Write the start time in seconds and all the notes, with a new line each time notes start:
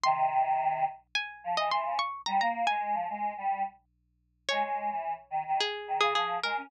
0.03 C3 D#3 C6
1.15 G#5
1.44 F3
1.57 E3 D#5
1.71 E3 C6
1.85 C#3
1.99 C#6
2.26 G3 A#5
2.41 A#3 A#5
2.67 G#3 G#5
2.94 F3
3.10 G#3
3.38 G3
4.49 G#3 C#5
4.63 G#3
4.91 E3
5.30 D#3
5.47 D#3
5.60 G#4
5.88 D#3
6.00 C#3 G#4
6.15 F3 G#4
6.43 G#3 A#4
6.57 C#4